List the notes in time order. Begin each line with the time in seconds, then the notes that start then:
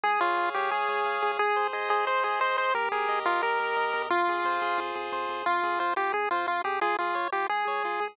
0.04 C#2 G#4
0.21 C#2 F4 C#5
0.37 C#2 F5
0.54 C#2 G4 C#5
0.71 C#2 G#4
0.89 C#2 C#5
1.05 C#2 F5
1.22 C#2 G#4
1.39 G#1 G#4
1.56 G#1 C5
1.73 G#1 G#4 D#5
1.90 G#1 G#4 C5
2.07 G#1 G#4 C5
2.23 G#1 G#4 C5
2.40 G#1 C5 D#5
2.57 G#1 C5
2.74 D#2 G4 A#4
2.91 D#2 G#4 A#4
3.08 D#2 D#5
3.25 D#2 F4 A#4
3.42 D#2 G4 A#4
3.59 D#2 A#4
3.76 D#2 D#5
3.93 E2 A#4
4.10 F2 F4
4.27 F2 G#4
4.44 F2 C5
4.61 F2 G#4
4.78 F2 F4
4.95 F2 G#4
5.12 F2 C5
5.29 F2 G#4
5.46 F2 F4
5.63 F2 G#4
5.79 F2 F4 C5
5.96 F2 F4 G4
6.13 F2 G#4
6.31 F2 F4 C5
6.47 F2 F4
6.64 F2 G4 G#4
6.81 C#2 F4 G#4
6.99 C#2 F4 G#4
7.14 C#2 C#5
7.32 C#2 F4 G4
7.49 C#2 G#4
7.67 C#2 C#5
7.84 C#2 F4
8.00 C#2 G#4